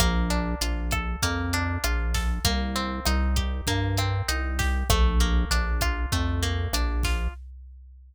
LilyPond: <<
  \new Staff \with { instrumentName = "Acoustic Guitar (steel)" } { \time 4/4 \key bes \major \tempo 4 = 98 bes8 d'8 f'8 a'8 bes8 d'8 f'8 a'8 | bes8 c'8 ees'8 g'8 bes8 c'8 ees'8 g'8 | a8 bes8 d'8 f'8 a8 bes8 d'8 f'8 | }
  \new Staff \with { instrumentName = "Synth Bass 1" } { \clef bass \time 4/4 \key bes \major bes,,4 bes,,4 f,4 bes,,4 | c,4 c,4 g,4 c,4 | bes,,4 bes,,4 f,4 bes,,4 | }
  \new DrumStaff \with { instrumentName = "Drums" } \drummode { \time 4/4 <hh bd ss>8 hh8 hh8 <hh bd ss>8 <hh bd>8 hh8 <hh ss>8 <hh bd sn>8 | <hh bd>8 hh8 <hh ss>8 <hh bd>8 <hh bd>8 <hh ss>8 hh8 <hh bd sn>8 | <hh bd ss>8 hh8 hh8 <hh bd ss>8 <hh bd>8 hh8 <hh ss>8 <hh bd sn>8 | }
>>